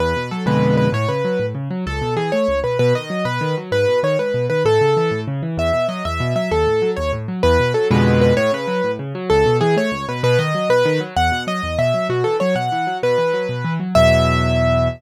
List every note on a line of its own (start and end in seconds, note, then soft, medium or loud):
0.00 0.14 E2 loud
0.00 0.30 B4 medium
0.16 0.30 B2 medium
0.31 0.46 F#3 medium
0.31 0.45 A4 medium
0.46 0.88 F2 loud
0.46 0.88 B2 loud
0.46 0.88 D3 medium
0.46 0.88 G#3 medium
0.46 0.76 B4 medium
0.77 0.90 B4 medium
0.92 1.06 A2 loud
0.92 1.09 C#5 medium
1.09 1.23 C#3 medium
1.09 1.46 B4 medium
1.25 1.39 F#3 medium
1.39 1.53 A2 medium
1.55 1.69 C#3 medium
1.71 1.84 F#3 medium
1.86 2.00 C#2 loud
1.86 2.14 A4 medium
2.02 2.16 B2 medium
2.16 2.30 E3 medium
2.16 2.31 G#4 medium
2.32 2.47 A3 medium
2.32 2.60 C#5 medium
2.48 2.62 C#2 medium
2.64 2.78 B2 medium
2.64 2.78 B4 medium
2.79 2.93 B2 loud
2.79 2.94 B4 medium
2.95 3.09 D#3 medium
2.95 3.25 D#5 medium
3.10 3.24 F#3 medium
3.25 3.39 B2 medium
3.25 3.55 B4 medium
3.41 3.55 D#3 medium
3.57 3.71 F#3 medium
3.72 3.86 G#2 medium
3.72 4.00 B4 medium
3.88 4.02 B2 medium
4.03 4.17 D#3 medium
4.03 4.18 C#5 medium
4.19 4.33 G#2 medium
4.19 4.46 B4 medium
4.34 4.48 B2 medium
4.50 4.64 D#3 medium
4.50 4.63 B4 medium
4.65 4.79 A2 loud
4.65 5.20 A4 medium
4.81 4.95 C#3 medium
4.97 5.11 E3 medium
5.11 5.25 A2 medium
5.28 5.41 C#3 medium
5.43 5.57 E3 medium
5.57 5.71 E2 loud
5.57 5.87 E5 medium
5.73 5.87 B2 medium
5.88 6.02 F#3 medium
5.88 6.04 D#5 medium
6.05 6.19 E2 medium
6.05 6.33 E5 medium
6.20 6.34 B2 medium
6.36 6.49 F#3 medium
6.36 6.51 E5 medium
6.51 6.65 D#2 loud
6.51 6.91 A4 medium
6.67 6.81 A2 medium
6.82 6.96 F#3 medium
6.96 7.12 D#2 medium
6.96 7.11 C#5 medium
7.13 7.27 A2 medium
7.28 7.42 F#3 medium
7.43 7.58 E2 loud
7.43 7.72 B4 medium
7.60 7.74 B2 medium
7.74 7.89 F#3 medium
7.74 7.88 A4 medium
7.91 8.32 F2 loud
7.91 8.32 B2 loud
7.91 8.32 D3 loud
7.91 8.32 G#3 loud
7.91 8.20 B4 medium
8.21 8.34 B4 medium
8.37 8.51 A2 loud
8.37 8.52 C#5 medium
8.52 8.66 C#3 medium
8.52 8.91 B4 medium
8.67 8.81 F#3 medium
8.84 8.98 A2 medium
8.99 9.13 C#3 medium
9.15 9.29 F#3 loud
9.30 9.44 C#2 loud
9.30 9.57 A4 medium
9.46 9.60 B2 medium
9.61 9.75 E3 medium
9.61 9.75 G#4 medium
9.77 9.91 A3 medium
9.77 10.05 C#5 medium
9.91 10.05 C#2 medium
10.08 10.22 B2 medium
10.08 10.23 B4 medium
10.23 10.37 B2 loud
10.23 10.38 B4 medium
10.39 10.53 D#3 medium
10.39 10.69 D#5 medium
10.55 10.69 F#3 medium
10.69 10.83 B2 medium
10.69 11.00 B4 medium
10.85 10.99 D#3 loud
11.00 11.14 F#3 medium
11.16 11.30 E2 loud
11.16 11.43 F#5 medium
11.32 11.46 B2 medium
11.47 11.61 F#3 medium
11.47 11.78 D#5 medium
11.63 11.77 E2 medium
11.78 11.92 B2 medium
11.78 12.07 E5 medium
11.94 12.08 F#3 medium
12.09 12.23 B2 medium
12.09 12.24 F#4 medium
12.24 12.39 E3 medium
12.24 12.37 A4 medium
12.40 12.55 F#3 medium
12.40 12.55 C#5 medium
12.55 12.69 B2 medium
12.55 12.98 F#5 medium
12.72 12.86 E3 medium
12.87 13.01 F#3 medium
13.03 13.17 B2 loud
13.03 13.74 B4 medium
13.18 13.32 E3 medium
13.34 13.47 F#3 medium
13.49 13.63 B2 medium
13.64 13.78 E3 medium
13.80 13.94 F#3 medium
13.95 14.88 E2 loud
13.95 14.88 B2 loud
13.95 14.88 F#3 medium
13.95 14.88 E5 loud